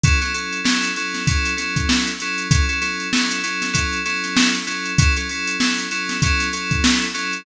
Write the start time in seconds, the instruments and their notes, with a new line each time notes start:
0.03 electric piano 2 F#3 C#4 E4 A4, kick, closed hi-hat
0.21 electric piano 2 F#3 C#4 E4 A4, snare, closed hi-hat
0.34 electric piano 2 F#3 C#4 E4 A4, closed hi-hat
0.53 closed hi-hat
0.64 electric piano 2 F#3 C#4 E4 A4, snare
0.83 closed hi-hat
0.96 electric piano 2 F#3 C#4 E4 A4, closed hi-hat
1.14 snare, closed hi-hat
1.27 electric piano 2 F#3 C#4 E4 A4, kick, closed hi-hat
1.45 closed hi-hat
1.57 electric piano 2 F#3 C#4 E4 A4, snare, closed hi-hat
1.76 kick, closed hi-hat
1.89 snare
2.07 closed hi-hat
2.20 electric piano 2 F#3 C#4 E4 A4, closed hi-hat
2.38 closed hi-hat
2.51 electric piano 2 F#3 C#4 E4 A4, kick, closed hi-hat
2.69 electric piano 2 F#3 C#4 E4 A4, closed hi-hat
2.81 electric piano 2 F#3 C#4 E4 A4, snare, closed hi-hat
3.00 closed hi-hat
3.13 electric piano 2 F#3 C#4 E4 A4, snare
3.31 closed hi-hat
3.43 electric piano 2 F#3 C#4 E4 A4, closed hi-hat
3.62 snare, closed hi-hat
3.73 electric piano 2 F#3 C#4 E4 A4, kick, closed hi-hat
3.93 closed hi-hat
4.05 electric piano 2 F#3 C#4 E4 A4, snare, closed hi-hat
4.24 snare, closed hi-hat
4.36 snare
4.55 closed hi-hat
4.67 electric piano 2 F#3 C#4 E4 A4, closed hi-hat
4.85 closed hi-hat
4.98 electric piano 2 F#3 C#4 E4 A4, kick, closed hi-hat
5.16 electric piano 2 F#3 C#4 E4 A4, closed hi-hat
5.29 electric piano 2 F#3 C#4 E4 A4, closed hi-hat
5.47 closed hi-hat
5.60 electric piano 2 F#3 C#4 E4 A4, snare
5.78 closed hi-hat
5.91 electric piano 2 F#3 C#4 E4 A4, closed hi-hat
6.09 snare, closed hi-hat
6.22 electric piano 2 F#3 C#4 E4 A4, kick, closed hi-hat
6.40 snare, closed hi-hat
6.53 electric piano 2 F#3 C#4 E4 A4, closed hi-hat
6.71 kick, closed hi-hat
6.84 snare
7.02 closed hi-hat
7.14 electric piano 2 F#3 C#4 E4 A4, closed hi-hat
7.33 closed hi-hat